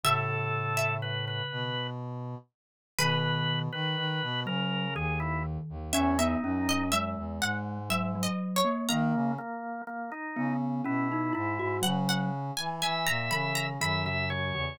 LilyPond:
<<
  \new Staff \with { instrumentName = "Harpsichord" } { \time 3/4 \key a \major \tempo 4 = 61 e''8. e''4~ e''16 r4 | \key b \major b'2. | e''16 e''8 dis''16 e''8 fis''8 \tuplet 3/2 { e''8 dis''8 cis''8 } | ais''2. |
fis''16 fis''8 gis''16 gis''16 ais''16 b''16 ais''16 b''4 | }
  \new Staff \with { instrumentName = "Drawbar Organ" } { \time 3/4 \key a \major a'4 b'16 b'8. r4 | \key b \major b'8. b'8. ais'8 gis'16 e'16 r8 | cis'16 dis'8. r2 | ais8 ais8 ais16 dis'8 r16 e'8 e'8 |
r4 e''4 e''16 e''16 cis''8 | }
  \new Staff \with { instrumentName = "Glockenspiel" } { \time 3/4 \key a \major cis2 r4 | \key b \major dis8. r8. fis8 dis4 | cis'16 b16 cis'8 gis4 fis16 fis8 ais16 | ais8 r4 b8 cis'16 dis'16 e'16 fis'16 |
fis8 r4 e8 dis16 cis16 cis16 cis16 | }
  \new Staff \with { instrumentName = "Brass Section" } { \clef bass \time 3/4 \key a \major a,4. b,4 r8 | \key b \major b,8. dis16 dis16 b,16 cis8 dis,8. dis,16 | e,8 fis,8. e,16 gis,4 r8 | dis16 cis16 r4 cis8 b,8 gis,16 gis,16 |
cis8. e16 e16 ais,16 cis8 fis,8. e,16 | }
>>